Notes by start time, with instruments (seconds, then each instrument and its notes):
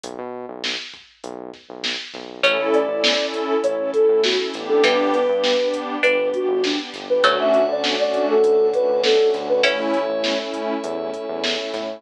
0.04 synth bass 1 B1, kick, closed hi-hat
0.19 synth bass 1 B2
0.49 synth bass 1 B1
0.64 snare
0.94 kick
1.24 synth bass 1 B1, kick, closed hi-hat
1.54 kick, snare
1.69 synth bass 1 B1
1.84 snare
2.14 synth bass 1 B1, kick, snare
2.42 synth bass 1 A1, pizzicato strings A3 C#4, pad 2 (warm) C#4 E4 A4, pad 5 (bowed) C#4 E4 A4, ocarina C#5, kick, closed hi-hat
2.59 synth bass 1 A1
2.73 ocarina D5, closed hi-hat
2.89 synth bass 1 A1, pad 2 (warm) C#4 E4 A4
3.04 snare
3.18 pad 2 (warm) C#4 E4 A4
3.34 kick, closed hi-hat
3.62 synth bass 1 A1, pad 2 (warm) C#4 E4 A4, ocarina C#5, kick, closed hi-hat
3.79 pad 2 (warm) C#4 E4 A4
3.93 pad 2 (warm) C#4 E4 A4, ocarina A4, kick, closed hi-hat
4.08 synth bass 1 A2, pad 2 (warm) C#4 E4 A4
4.22 pad 2 (warm) C#4 E4 A4, ocarina F#4, snare
4.38 pad 2 (warm) C#4 E4 A4
4.53 synth bass 1 A1, pad 2 (warm) B3 D4 G4, snare, closed hi-hat
4.68 ocarina A4
4.83 synth bass 1 G1, pizzicato strings E3 G3, pad 5 (bowed) B3 D4 G4, ocarina B4, kick, closed hi-hat
4.99 synth bass 1 G1
5.12 ocarina B4, closed hi-hat
5.28 synth bass 1 G2, pad 2 (warm) B3 D4 G4
5.44 snare
5.60 pad 2 (warm) B3 D4 G4
5.74 kick, closed hi-hat
6.03 synth bass 1 G1, pad 2 (warm) B3 D4 G4, pizzicato strings D4, ocarina B4, kick, closed hi-hat
6.18 pad 2 (warm) B3 D4 G4
6.33 pad 2 (warm) B3 D4 G4, ocarina F#4, kick, closed hi-hat
6.49 synth bass 1 G1, pad 2 (warm) B3 D4 G4
6.63 pad 2 (warm) B3 D4 G4, ocarina D4, snare
6.78 pad 2 (warm) B3 D4 G4
6.92 synth bass 1 G1, pad 2 (warm) B3 D4 G4, kick, snare, closed hi-hat
7.10 pad 2 (warm) B3 D4 G4, ocarina B4
7.23 synth bass 1 D2, pizzicato strings F#3 A3, pad 2 (warm) A3 C#4 D4 F#4, pad 5 (bowed) A4 C#5 D5 F#5, ocarina C#5, kick, closed hi-hat
7.39 synth bass 1 D2, ocarina E5
7.54 closed hi-hat
7.69 synth bass 1 D2, pad 2 (warm) A3 C#4 D4 F#4, ocarina D5
7.84 snare
7.98 pad 2 (warm) A3 C#4 D4 F#4, ocarina D5
8.14 kick, closed hi-hat
8.29 ocarina A4
8.43 synth bass 1 D2, pad 2 (warm) A3 C#4 D4 F#4, kick, closed hi-hat
8.58 pad 2 (warm) A3 C#4 D4 F#4
8.73 pad 2 (warm) A3 C#4 D4 F#4, ocarina B4, kick, closed hi-hat
8.89 synth bass 1 D2, pad 2 (warm) A3 C#4 D4 F#4
9.04 pad 2 (warm) A3 C#4 D4 F#4, ocarina A4, snare
9.19 pad 2 (warm) A3 C#4 D4 F#4
9.34 synth bass 1 D2, pad 2 (warm) A3 C#4 D4 F#4, snare, closed hi-hat
9.48 pad 2 (warm) A3 C#4 D4 F#4, ocarina B4
9.63 synth bass 1 A1, pad 2 (warm) A3 C#4 E4, pizzicato strings C#4 E4, pad 5 (bowed) A4 C#5 E5, ocarina C#5, kick, closed hi-hat
9.79 synth bass 1 A1
9.94 closed hi-hat
10.09 synth bass 1 A1, pad 2 (warm) A3 C#4 E4
10.24 snare
10.38 pad 2 (warm) A3 C#4 E4
10.54 kick, closed hi-hat
10.84 synth bass 1 E2, pad 2 (warm) A3 C#4 E4, kick, closed hi-hat
10.98 pad 2 (warm) A3 C#4 E4
11.13 pad 2 (warm) A3 C#4 E4, kick, closed hi-hat
11.28 synth bass 1 E2, pad 2 (warm) A3 C#4 E4
11.44 pad 2 (warm) A3 C#4 E4, snare
11.59 pad 2 (warm) A3 C#4 E4
11.74 synth bass 1 A2, pad 2 (warm) A3 C#4 E4, kick, snare, closed hi-hat
11.88 pad 2 (warm) A3 C#4 E4